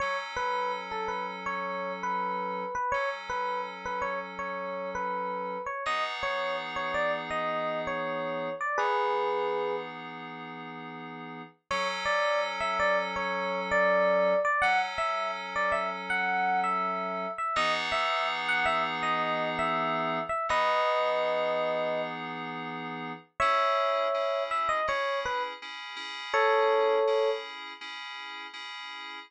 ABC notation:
X:1
M:4/4
L:1/16
Q:1/4=82
K:F#m
V:1 name="Electric Piano 1"
c z B2 z A B z c3 B4 B | c z B2 z B c z c3 B4 c | ^d z c2 z c =d z ^d3 c4 =d | [GB]6 z10 |
c z d2 z e d z c3 d4 d | f z e2 z d e z f3 e4 e | ^d z e2 z f e z d3 e4 e | [B^d]10 z6 |
[K:C#m] [ce]6 e d c2 B z5 | [Ac]6 z10 |]
V:2 name="Electric Piano 2"
[F,CA]16 | [F,CA]16 | [E,B,^DG]16 | [E,B,^DG]16 |
[F,CA]16 | [F,CA]16 | [E,B,^DG]16 | [E,B,^DG]16 |
[K:C#m] [CEG]4 [CEG]4 [CEG]4 [CEG]2 [CEG]2- | [CEG]4 [CEG]4 [CEG]4 [CEG]4 |]